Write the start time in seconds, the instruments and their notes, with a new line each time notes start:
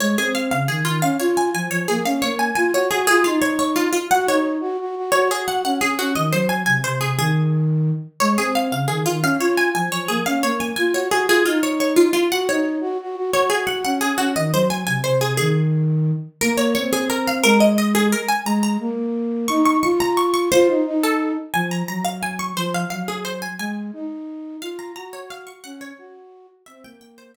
0.00 flute G#3, harpsichord C#5
0.18 flute C4, harpsichord G#4
0.35 harpsichord F5
0.51 flute C#3, harpsichord F5
0.68 flute D#3, harpsichord G#4
0.85 flute D#3, harpsichord F4
1.02 flute C#4, harpsichord F5
1.20 flute F4, harpsichord C#5
1.37 harpsichord G#5
1.54 flute F3, harpsichord G#5
1.70 flute F3, harpsichord C#5
1.88 flute A#3, harpsichord G#4
2.05 flute C#4, harpsichord F5
2.22 flute A#3, harpsichord C#5
2.39 harpsichord G#5
2.55 flute F4, harpsichord G#5
2.73 flute F#4, harpsichord C#5
2.91 flute F#4, harpsichord G#4
3.07 flute F4, harpsichord G#4
3.24 flute D#4, harpsichord F4
3.42 harpsichord C#5
3.59 harpsichord C#5
3.76 harpsichord F4
3.93 harpsichord F4
4.11 flute F#4, harpsichord F#5
4.26 flute D#4, harpsichord C#5
4.60 flute F#4
4.79 flute F#4
4.96 flute F#4
5.12 flute F#4, harpsichord C#5
5.30 flute F#4, harpsichord G#4
5.48 harpsichord F#5
5.64 flute C#4, harpsichord F#5
5.80 flute C#4, harpsichord G#4
5.98 flute C#4, harpsichord F#4
6.15 flute D#3, harpsichord D#5
6.32 flute F#3, harpsichord C5
6.49 harpsichord G#5
6.66 flute C3, harpsichord G#5
6.84 flute C3, harpsichord C5
7.01 flute C3, harpsichord G#4
7.18 flute D#3, harpsichord G#4
8.20 flute G#3, harpsichord C#5
8.37 flute C4, harpsichord G#4
8.55 harpsichord F5
8.71 flute C#3, harpsichord F5
8.88 flute D#3, harpsichord G#4
9.06 flute D#3, harpsichord F4
9.22 flute C#4, harpsichord F5
9.39 flute F4, harpsichord C#5
9.57 harpsichord G#5
9.75 flute F3, harpsichord G#5
9.92 flute F3, harpsichord C#5
10.08 flute A#3, harpsichord G#4
10.26 flute C#4, harpsichord F5
10.43 flute A#3, harpsichord C#5
10.60 harpsichord G#5
10.76 flute F4, harpsichord G#5
10.93 flute F#4, harpsichord C#5
11.11 flute F#4, harpsichord G#4
11.27 flute F4, harpsichord G#4
11.46 flute D#4, harpsichord F4
11.63 harpsichord C#5
11.80 harpsichord C#5
11.96 harpsichord F4
12.13 harpsichord F4
12.31 flute F#4, harpsichord F#5
12.48 flute D#4, harpsichord C#5
12.81 flute F#4
13.00 flute F#4
13.16 flute F#4
13.33 flute F#4, harpsichord C#5
13.50 flute F#4, harpsichord G#4
13.67 harpsichord F#5
13.84 flute C#4, harpsichord F#5
14.01 flute C#4, harpsichord G#4
14.18 flute C#4, harpsichord F#4
14.36 flute D#3, harpsichord D#5
14.53 flute F#3, harpsichord C5
14.70 harpsichord G#5
14.86 flute C3, harpsichord G#5
15.04 flute C3, harpsichord C5
15.21 flute C3, harpsichord G#4
15.37 flute D#3, harpsichord G#4
16.41 flute A#3, harpsichord A#4
16.57 harpsichord C#5
16.75 flute C4, harpsichord C#5
16.93 harpsichord G#4
17.10 harpsichord A#4
17.27 harpsichord F5
17.44 flute G#3, harpsichord A#4
17.60 harpsichord D#5
17.78 harpsichord D#5
17.95 harpsichord G#4
18.12 harpsichord A#4
18.28 harpsichord G#5
18.45 flute G#3, harpsichord A#5
18.63 harpsichord A#5
18.80 flute A#3
19.48 flute D#4, harpsichord C#6
19.66 harpsichord C#6
19.83 flute F4, harpsichord C#6
20.00 harpsichord A#5
20.17 harpsichord C#6
20.34 harpsichord C#6
20.52 flute F4, harpsichord C5
20.68 flute D#4
20.86 flute D#4
21.03 harpsichord A4
21.53 flute F3, harpsichord G#5
21.71 harpsichord A#5
21.88 flute F#3, harpsichord A#5
22.05 harpsichord F5
22.23 harpsichord G#5
22.39 harpsichord C#6
22.57 flute F3, harpsichord C5
22.74 harpsichord F5
22.90 flute F#3, harpsichord F5
23.08 harpsichord G#4
23.25 harpsichord C5
23.42 harpsichord G#5
23.59 flute G#3, harpsichord G#5
23.93 flute D#4
24.61 flute F4, harpsichord F5
24.79 harpsichord A#5
24.96 flute F#4, harpsichord A#5
25.13 harpsichord C#5
25.30 harpsichord F5
25.47 harpsichord C#6
25.64 flute C#4, harpsichord F#5
25.81 harpsichord C#5
25.98 flute F#4
26.66 flute C4, harpsichord E5
26.84 flute A#3, harpsichord G5
27.01 harpsichord G5
27.18 harpsichord C5
27.34 harpsichord E5